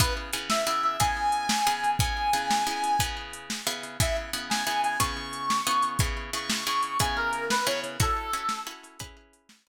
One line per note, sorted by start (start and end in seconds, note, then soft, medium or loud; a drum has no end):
0.00 0.31 C#3 medium
0.00 0.31 B3 medium
0.00 0.31 E4 medium
0.00 0.31 G#4 medium
0.00 0.13 B4 medium
0.00 kick loud
0.00 closed hi-hat loud
0.33 0.64 C#3 medium
0.33 0.64 B3 medium
0.33 0.64 E4 medium
0.33 0.64 G#4 medium
0.33 closed hi-hat medium
0.49 0.65 E5 medium
0.49 snare loud
0.66 0.97 C#3 medium
0.66 0.97 B3 medium
0.66 0.97 E4 medium
0.66 0.97 G#4 medium
0.66 0.82 E5 medium
0.83 0.97 E5 medium
1.00 1.61 C#3 medium
1.00 1.61 B3 medium
1.00 1.61 E4 medium
1.00 1.61 G#4 medium
1.00 1.91 G#5 medium
1.00 kick medium
1.00 closed hi-hat loud
1.32 closed hi-hat medium
1.49 snare loud
1.67 1.97 C#3 medium
1.67 1.97 B3 medium
1.67 1.97 E4 medium
1.67 1.97 G#4 medium
1.84 closed hi-hat medium
1.99 2.31 C#3 medium
1.99 2.31 B3 medium
1.99 2.31 E4 medium
1.99 2.31 G#4 medium
1.99 3.04 G#5 medium
1.99 kick loud
1.99 closed hi-hat loud
2.33 2.64 C#3 medium
2.33 2.64 B3 medium
2.33 2.64 E4 medium
2.33 2.64 G#4 medium
2.33 closed hi-hat medium
2.51 snare loud
2.67 2.97 C#3 medium
2.67 2.97 B3 medium
2.67 2.97 E4 medium
2.67 2.97 G#4 medium
2.84 closed hi-hat medium
2.99 3.61 C#3 medium
2.99 3.61 B3 medium
2.99 3.61 E4 medium
2.99 3.61 G#4 medium
2.99 kick medium
2.99 closed hi-hat loud
3.33 closed hi-hat medium
3.50 snare loud
3.67 3.97 C#3 medium
3.67 3.97 B3 medium
3.67 3.97 E4 medium
3.67 3.97 G#4 medium
3.83 closed hi-hat medium
4.00 4.31 C#3 medium
4.00 4.31 B3 medium
4.00 4.31 E4 medium
4.00 4.31 G#4 medium
4.00 4.17 E5 medium
4.00 kick loud
4.00 closed hi-hat loud
4.33 4.64 C#3 medium
4.33 4.64 B3 medium
4.33 4.64 E4 medium
4.33 4.64 G#4 medium
4.33 closed hi-hat medium
4.50 4.64 G#5 medium
4.50 snare loud
4.66 4.97 C#3 medium
4.66 4.97 B3 medium
4.66 4.97 E4 medium
4.66 4.97 G#4 medium
4.66 4.81 G#5 medium
4.83 4.98 G#5 medium
4.83 closed hi-hat medium
4.99 5.61 C#3 loud
4.99 5.61 B3 medium
4.99 5.61 E4 medium
4.99 5.61 G#4 medium
4.99 5.89 C#6 medium
4.99 kick medium
4.99 closed hi-hat loud
5.33 closed hi-hat medium
5.50 snare loud
5.67 5.97 C#3 medium
5.67 5.97 B3 medium
5.67 5.97 E4 medium
5.67 5.97 G#4 medium
5.82 closed hi-hat medium
5.99 6.31 C#3 medium
5.99 6.31 B3 medium
5.99 6.31 E4 medium
5.99 6.31 G#4 medium
5.99 kick loud
5.99 closed hi-hat loud
6.33 6.64 C#3 medium
6.33 6.64 B3 medium
6.33 6.64 E4 medium
6.33 6.64 G#4 medium
6.33 6.65 C#6 medium
6.33 closed hi-hat medium
6.50 snare loud
6.66 6.97 C#3 medium
6.66 6.97 B3 medium
6.66 6.97 E4 medium
6.66 6.97 G#4 medium
6.66 6.98 C#6 medium
6.83 closed hi-hat medium
6.99 7.61 C#3 medium
6.99 7.61 B3 medium
6.99 7.61 E4 medium
6.99 7.61 G#4 medium
6.99 7.16 G#5 medium
6.99 kick medium
6.99 closed hi-hat loud
7.16 7.45 A#4 medium
7.33 closed hi-hat medium
7.50 7.66 B4 medium
7.50 snare loud
7.65 7.97 C#3 medium
7.65 7.97 B3 medium
7.65 7.97 E4 medium
7.65 7.97 G#4 medium
7.65 7.80 C#5 medium
7.84 closed hi-hat medium
8.00 8.31 C#4 medium
8.00 8.31 E4 medium
8.00 8.31 F#4 medium
8.00 8.31 A4 medium
8.00 8.60 A4 loud
8.00 kick loud
8.00 closed hi-hat loud
8.33 8.64 C#4 medium
8.33 8.64 E4 medium
8.33 8.64 F#4 medium
8.33 8.64 A4 medium
8.33 closed hi-hat medium
8.49 snare loud
8.67 8.97 C#4 medium
8.67 8.97 E4 medium
8.67 8.97 F#4 medium
8.67 8.97 A4 medium
8.84 closed hi-hat medium
8.99 9.61 C#4 medium
8.99 9.61 E4 medium
8.99 9.61 G#4 medium
8.99 9.61 B4 medium
8.99 kick medium
8.99 closed hi-hat loud
9.33 closed hi-hat medium
9.49 snare loud
9.67 9.68 C#4 medium
9.67 9.68 E4 medium
9.67 9.68 G#4 medium
9.67 9.68 B4 medium